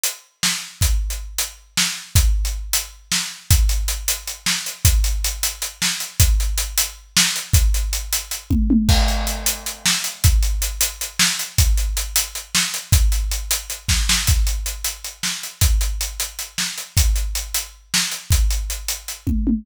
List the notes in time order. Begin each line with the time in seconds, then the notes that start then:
0.04 closed hi-hat
0.43 snare
0.81 kick, closed hi-hat
1.10 closed hi-hat
1.38 closed hi-hat
1.77 snare
2.15 kick, closed hi-hat
2.45 closed hi-hat
2.73 closed hi-hat
3.12 snare
3.51 kick, closed hi-hat
3.69 closed hi-hat
3.88 closed hi-hat
4.08 closed hi-hat
4.27 closed hi-hat
4.46 snare
4.66 closed hi-hat
4.85 kick, closed hi-hat
5.04 closed hi-hat
5.24 closed hi-hat
5.43 closed hi-hat
5.62 closed hi-hat
5.82 snare
6.00 closed hi-hat
6.20 kick, closed hi-hat
6.40 closed hi-hat
6.58 closed hi-hat
6.78 closed hi-hat
7.17 snare
7.36 closed hi-hat
7.53 kick, closed hi-hat
7.74 closed hi-hat
7.93 closed hi-hat
8.13 closed hi-hat
8.31 closed hi-hat
8.50 kick, high tom
8.70 high tom
8.89 kick, crash
9.08 closed hi-hat
9.27 closed hi-hat
9.46 closed hi-hat
9.66 closed hi-hat
9.86 snare
10.04 closed hi-hat
10.24 kick, closed hi-hat
10.43 closed hi-hat
10.62 closed hi-hat
10.81 closed hi-hat
11.01 closed hi-hat
11.19 snare
11.39 closed hi-hat
11.58 kick, closed hi-hat
11.77 closed hi-hat
11.97 closed hi-hat
12.16 closed hi-hat
12.35 closed hi-hat
12.55 snare
12.74 closed hi-hat
12.92 kick, closed hi-hat
13.12 closed hi-hat
13.31 closed hi-hat
13.51 closed hi-hat
13.70 closed hi-hat
13.88 kick, snare
14.09 snare
14.27 kick, closed hi-hat
14.47 closed hi-hat
14.66 closed hi-hat
14.84 closed hi-hat
15.04 closed hi-hat
15.23 snare
15.43 closed hi-hat
15.61 kick, closed hi-hat
15.81 closed hi-hat
16.01 closed hi-hat
16.20 closed hi-hat
16.39 closed hi-hat
16.58 snare
16.78 closed hi-hat
16.97 kick, closed hi-hat
17.16 closed hi-hat
17.35 closed hi-hat
17.54 closed hi-hat
17.94 snare
18.11 closed hi-hat
18.31 kick, closed hi-hat
18.50 closed hi-hat
18.70 closed hi-hat
18.88 closed hi-hat
19.08 closed hi-hat
19.27 kick, high tom
19.47 high tom